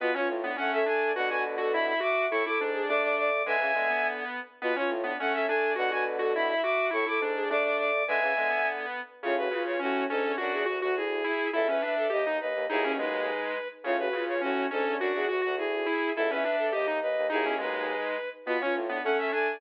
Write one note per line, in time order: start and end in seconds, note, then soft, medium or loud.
0.00 0.12 B2 loud
0.00 0.15 B3 medium
0.00 0.14 F4 medium
0.00 0.13 B4 loud
0.14 0.27 C#4 medium
0.14 0.40 F4 medium
0.14 0.28 C#5 loud
0.28 0.52 A2 loud
0.43 0.56 B3 medium
0.43 0.56 D4 medium
0.56 1.12 A3 loud
0.56 0.82 C#4 medium
0.56 0.71 A4 medium
0.56 0.71 F#5 medium
0.72 0.84 A4 medium
0.72 0.85 E5 loud
0.86 1.11 D4 medium
0.86 1.12 A4 medium
0.86 1.12 G#5 medium
1.15 1.94 B2 loud
1.15 1.94 D3 loud
1.15 1.28 F#4 medium
1.15 1.27 B4 medium
1.15 1.29 F#5 loud
1.30 1.43 F#4 medium
1.30 1.56 B4 medium
1.30 1.43 G#5 medium
1.58 1.71 F#4 medium
1.58 1.71 A4 medium
1.73 2.00 E4 medium
1.73 1.86 E5 medium
1.73 1.86 B5 medium
1.87 1.99 E5 medium
1.87 1.99 B5 medium
2.00 2.25 F#4 medium
2.00 2.26 E5 medium
2.00 2.25 D6 loud
2.30 2.43 A2 loud
2.30 2.44 E4 loud
2.30 2.43 A4 medium
2.30 2.44 C#6 loud
2.45 2.58 E4 medium
2.45 2.71 A4 medium
2.45 2.59 D6 medium
2.59 2.82 G#2 loud
2.59 2.87 D4 medium
2.74 2.86 G#4 medium
2.88 3.42 A3 loud
2.88 3.29 D4 medium
2.88 3.02 D5 medium
2.88 3.02 D6 loud
3.02 3.15 D5 medium
3.02 3.15 D6 medium
3.17 3.42 D5 medium
3.17 3.43 D6 loud
3.45 3.57 D3 loud
3.45 3.60 G#3 medium
3.45 3.73 B4 medium
3.45 4.07 E5 loud
3.45 4.07 G#5 loud
3.60 3.72 C#3 loud
3.60 3.74 E3 medium
3.75 4.24 D3 medium
3.75 3.88 G#3 medium
3.75 4.39 B3 medium
3.90 4.02 B3 medium
4.03 4.39 B3 medium
4.62 4.74 B2 loud
4.62 4.76 B3 medium
4.62 4.75 F4 medium
4.62 4.74 B4 loud
4.76 4.90 C#4 medium
4.76 5.01 F4 medium
4.76 4.90 C#5 loud
4.89 5.13 A2 loud
5.04 5.16 B3 medium
5.04 5.18 D4 medium
5.19 5.73 A3 loud
5.19 5.46 C#4 medium
5.19 5.33 A4 medium
5.19 5.33 F#5 medium
5.33 5.45 A4 medium
5.33 5.46 E5 loud
5.48 5.74 D4 medium
5.48 5.73 A4 medium
5.48 5.73 G#5 medium
5.76 6.54 B2 loud
5.76 6.54 D3 loud
5.76 5.88 F#4 medium
5.76 5.89 B4 medium
5.76 5.91 F#5 loud
5.91 6.03 F#4 medium
5.91 6.18 B4 medium
5.91 6.05 G#5 medium
6.19 6.32 F#4 medium
6.19 6.32 A4 medium
6.34 6.62 E4 medium
6.34 6.47 E5 medium
6.34 6.48 B5 medium
6.49 6.61 E5 medium
6.49 6.61 B5 medium
6.63 6.89 F#4 medium
6.63 6.87 E5 medium
6.63 6.87 D6 loud
6.91 7.05 A2 loud
6.91 7.03 E4 loud
6.91 7.05 A4 medium
6.91 7.06 C#6 loud
7.06 7.18 E4 medium
7.06 7.32 A4 medium
7.06 7.20 D6 medium
7.20 7.43 G#2 loud
7.20 7.48 D4 medium
7.36 7.48 G#4 medium
7.49 8.03 A3 loud
7.49 7.90 D4 medium
7.49 7.63 D5 medium
7.49 7.64 D6 loud
7.64 7.76 D5 medium
7.64 7.76 D6 medium
7.78 8.02 D5 medium
7.78 8.05 D6 loud
8.08 8.20 D3 loud
8.08 8.22 G#3 medium
8.08 8.34 B4 medium
8.08 8.69 E5 loud
8.08 8.69 G#5 loud
8.21 8.33 C#3 loud
8.21 8.37 E3 medium
8.36 8.86 D3 medium
8.36 8.49 G#3 medium
8.36 8.99 B3 medium
8.49 8.61 B3 medium
8.64 9.00 B3 medium
9.23 9.48 A2 loud
9.23 9.36 C#3 loud
9.23 9.48 C#3 loud
9.23 9.35 F4 medium
9.23 9.35 C#5 loud
9.38 9.51 F#4 medium
9.38 9.63 B4 loud
9.51 9.76 C#3 medium
9.51 9.80 F4 medium
9.66 9.79 C#5 medium
9.79 10.06 A2 loud
9.79 10.04 C#4 medium
9.79 10.06 C#4 medium
9.79 10.04 F#4 loud
10.09 10.23 G#2 loud
10.09 10.35 C#4 medium
10.09 10.35 D4 medium
10.09 10.32 A4 loud
10.25 10.38 E2 medium
10.38 10.53 F#2 loud
10.38 10.63 D4 medium
10.38 10.63 F#4 medium
10.38 10.63 F#4 loud
10.38 10.52 F#4 medium
10.52 10.65 E2 loud
10.52 10.66 G#4 medium
10.66 10.81 D2 medium
10.66 10.78 F#4 medium
10.66 10.94 F#4 medium
10.66 10.79 F#4 medium
10.82 11.23 D2 loud
10.82 10.94 F#4 loud
10.82 10.94 F#4 medium
10.96 11.22 E4 medium
10.96 11.50 G#4 medium
11.24 11.48 E4 medium
11.53 11.78 C#2 medium
11.53 11.78 E2 loud
11.53 11.66 E4 loud
11.53 11.67 A4 loud
11.53 11.67 E5 medium
11.68 11.81 C#4 medium
11.68 11.95 B4 medium
11.68 11.80 E5 medium
11.82 12.06 D4 medium
11.82 12.07 E5 medium
11.97 12.11 A4 medium
12.10 12.39 D#2 loud
12.10 12.22 G4 medium
12.10 12.38 D#5 medium
12.10 12.37 D#5 medium
12.26 12.39 D#4 medium
12.40 12.54 D#2 medium
12.40 12.65 B4 medium
12.40 12.65 D#5 medium
12.55 12.67 D#2 loud
12.69 13.31 B1 loud
12.69 13.31 D#2 loud
12.69 12.83 D#4 medium
12.69 12.93 E4 loud
12.69 12.93 G#4 loud
12.84 12.97 C#4 medium
12.98 13.57 G#3 medium
12.98 13.54 D#4 medium
12.98 13.68 B4 medium
13.84 14.09 A2 loud
13.84 13.97 C#3 loud
13.84 14.09 C#3 loud
13.84 13.97 F4 medium
13.84 13.97 C#5 loud
13.99 14.13 F#4 medium
13.99 14.24 B4 loud
14.13 14.38 C#3 medium
14.13 14.41 F4 medium
14.28 14.41 C#5 medium
14.41 14.67 A2 loud
14.41 14.66 C#4 medium
14.41 14.67 C#4 medium
14.41 14.66 F#4 loud
14.71 14.84 G#2 loud
14.71 14.96 C#4 medium
14.71 14.96 D4 medium
14.71 14.94 A4 loud
14.86 14.99 E2 medium
14.99 15.13 F#2 loud
14.99 15.25 D4 medium
14.99 15.13 F#4 medium
14.99 15.25 F#4 loud
14.99 15.26 F#4 medium
15.14 15.27 E2 loud
15.14 15.28 G#4 medium
15.28 15.42 D2 medium
15.28 15.40 F#4 medium
15.28 15.55 F#4 medium
15.28 15.41 F#4 medium
15.41 15.86 D2 loud
15.41 15.54 F#4 medium
15.41 15.55 F#4 loud
15.57 15.83 E4 medium
15.57 16.12 G#4 medium
15.86 16.10 E4 medium
16.15 16.42 C#2 medium
16.15 16.42 E2 loud
16.15 16.30 E4 loud
16.15 16.29 A4 loud
16.15 16.30 E5 medium
16.29 16.44 C#4 medium
16.29 16.56 B4 medium
16.29 16.42 E5 medium
16.43 16.68 D4 medium
16.43 16.67 E5 medium
16.58 16.72 A4 medium
16.72 17.01 D#2 loud
16.72 16.85 G4 medium
16.72 16.98 D#5 medium
16.72 16.99 D#5 medium
16.87 16.99 D#4 medium
17.02 17.16 D#2 medium
17.02 17.27 B4 medium
17.02 17.27 D#5 medium
17.17 17.30 D#2 loud
17.30 17.94 B1 loud
17.30 17.94 D#2 loud
17.30 17.43 D#4 medium
17.30 17.44 D#4 medium
17.30 17.54 E4 loud
17.30 17.54 G#4 loud
17.45 17.58 C#4 medium
17.58 18.17 G#3 medium
17.58 18.14 D#4 medium
17.58 18.29 B4 medium
18.46 18.57 B2 loud
18.46 18.61 B3 medium
18.46 18.59 F4 medium
18.46 18.59 B4 loud
18.60 18.75 C#4 medium
18.60 18.86 F4 medium
18.60 18.74 C#5 loud
18.75 18.99 A2 loud
18.89 19.02 B3 medium
18.89 19.03 D4 medium
19.04 19.58 A3 loud
19.04 19.31 C#4 medium
19.04 19.17 A4 medium
19.04 19.17 F#5 medium
19.18 19.30 A4 medium
19.18 19.31 E5 loud
19.31 19.56 D4 medium
19.31 19.57 A4 medium
19.31 19.58 G#5 medium